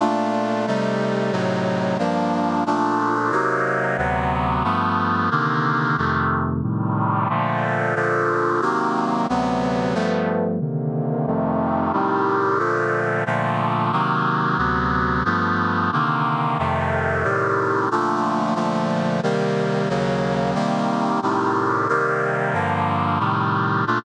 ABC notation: X:1
M:4/4
L:1/8
Q:1/4=181
K:Bb
V:1 name="Brass Section"
[B,,A,DF]4 [C,G,A,E]4 | [A,,C,_G,E]4 [=G,,F,B,D]4 | [B,,F,A,D]4 [C,_G,B,E]4 | [D,,C,^F,=B,]4 [G,,=F,A,B,]4 |
[C,D,E,B,]4 [F,,C,E,A,]4 | [A,,C,E,G,]4 [B,,D,F,A,]4 | [B,,D,F,A,]4 [C,E,_G,B,]4 | [D,,C,^F,=B,]4 [G,,=F,A,B,]4 |
[C,D,E,B,]4 [F,,C,E,A,]4 | [A,,C,E,G,]4 [B,,D,F,A,]4 | [B,,D,F,A,]4 [C,E,_G,B,]4 | [D,,C,^F,=B,]4 [G,,=F,A,B,]4 |
[C,D,E,B,]4 [F,,C,E,A,]4 | [A,,C,E,G,]4 [B,,D,F,A,]4 | [B,,D,F,A,]4 [C,E,G,B,]4 | [E,,_D,_G,B,]4 [C,E,=G,B,]4 |
[A,,C,E,G,]4 [C,E,G,B,]4 | [G,,D,F,B,]4 [A,,C,E,G,]4 | [B,,A,DF]2 z6 |]